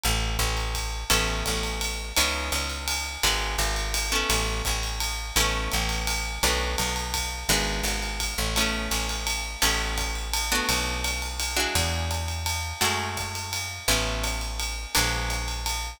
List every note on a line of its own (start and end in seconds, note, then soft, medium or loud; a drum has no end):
0.04 0.37 A1 medium
0.04 ride medium
0.39 1.04 A1 medium
0.39 kick medium
0.39 hi-hat pedal medium
0.39 ride medium
0.57 ride medium
0.74 kick medium
0.74 ride medium
1.10 1.43 A1 medium
1.10 2.14 B3 medium
1.10 2.14 C#4 medium
1.10 2.14 E4 medium
1.10 2.14 A4 medium
1.10 kick medium
1.10 ride loud
1.46 2.13 A1 medium
1.46 kick medium
1.46 hi-hat pedal medium
1.46 ride medium
1.63 ride medium
1.81 ride medium
2.16 2.50 C#2 medium
2.16 3.22 B3 medium
2.16 3.22 C#4 medium
2.16 3.22 D#4 medium
2.16 3.22 E4 medium
2.16 ride loud
2.52 3.18 C#2 medium
2.52 hi-hat pedal medium
2.52 ride medium
2.70 ride medium
2.88 ride loud
3.23 3.56 G#1 medium
3.23 4.08 G#3 medium
3.23 4.08 B3 medium
3.23 4.08 D4 medium
3.23 4.08 F#4 medium
3.23 kick medium
3.23 ride medium
3.58 4.24 G#1 medium
3.58 hi-hat pedal medium
3.58 ride medium
3.76 ride medium
3.94 ride loud
4.12 5.34 A3 medium
4.12 5.34 B3 medium
4.12 5.34 C#4 medium
4.12 5.34 E4 medium
4.30 4.62 A1 medium
4.30 ride loud
4.65 5.32 A1 medium
4.65 kick medium
4.65 hi-hat pedal medium
4.65 ride medium
4.83 ride medium
5.00 ride medium
5.36 5.69 A1 medium
5.36 6.41 A3 medium
5.36 6.41 B3 medium
5.36 6.41 C#4 medium
5.36 6.41 E4 medium
5.36 ride loud
5.72 6.39 A1 medium
5.72 hi-hat pedal medium
5.72 ride medium
5.89 ride medium
6.07 ride loud
6.43 6.76 B1 medium
6.43 7.48 A3 medium
6.43 7.48 B3 medium
6.43 7.48 D4 medium
6.43 7.48 F#4 medium
6.43 kick medium
6.43 ride medium
6.78 7.45 B1 medium
6.78 hi-hat pedal medium
6.78 ride medium
6.96 ride medium
7.14 kick medium
7.14 ride loud
7.49 7.82 G#1 medium
7.49 8.54 G#3 medium
7.49 8.54 B3 medium
7.49 8.54 D4 medium
7.49 8.54 F#4 medium
7.49 ride loud
7.83 8.34 G#1 medium
7.83 hi-hat pedal medium
7.83 ride medium
8.02 ride medium
8.20 kick medium
8.20 ride medium
8.38 8.88 A1 medium
8.56 9.61 A3 medium
8.56 9.61 B3 medium
8.56 9.61 C#4 medium
8.56 9.61 E4 medium
8.56 ride medium
8.91 9.56 A1 medium
8.91 hi-hat pedal medium
8.91 ride medium
9.09 ride medium
9.27 ride medium
9.62 10.61 A1 medium
9.62 10.46 A3 medium
9.62 10.46 B3 medium
9.62 10.46 C#4 medium
9.62 10.46 E4 medium
9.62 ride loud
9.98 kick medium
9.98 hi-hat pedal medium
9.98 ride medium
10.15 ride medium
10.34 ride loud
10.52 11.53 A3 medium
10.52 11.53 B3 medium
10.52 11.53 D4 medium
10.52 11.53 F#4 medium
10.69 11.67 B1 medium
10.69 ride loud
11.04 hi-hat pedal medium
11.04 ride medium
11.22 ride medium
11.40 ride medium
11.57 12.79 G#3 medium
11.57 12.79 D4 medium
11.57 12.79 E4 medium
11.57 12.79 F#4 medium
11.75 12.73 E2 medium
11.75 kick medium
11.75 ride loud
12.11 hi-hat pedal medium
12.11 ride medium
12.28 ride medium
12.46 ride loud
12.81 13.80 F#2 medium
12.81 13.85 G#3 medium
12.81 13.85 A3 medium
12.81 13.85 E4 medium
12.81 13.85 F#4 medium
12.81 ride medium
13.17 kick medium
13.17 hi-hat pedal medium
13.17 ride medium
13.35 ride medium
13.53 ride medium
13.88 14.86 A1 medium
13.88 14.92 A3 medium
13.88 14.92 B3 medium
13.88 14.92 C#4 medium
13.88 14.92 E4 medium
13.88 kick medium
13.88 ride medium
14.24 hi-hat pedal medium
14.24 ride medium
14.41 ride medium
14.60 ride medium
14.95 15.94 A#1 medium
14.95 15.99 G#3 medium
14.95 15.99 A#3 medium
14.95 15.99 B3 medium
14.95 15.99 D4 medium
14.95 ride loud
15.30 hi-hat pedal medium
15.30 ride medium
15.48 ride medium
15.66 ride medium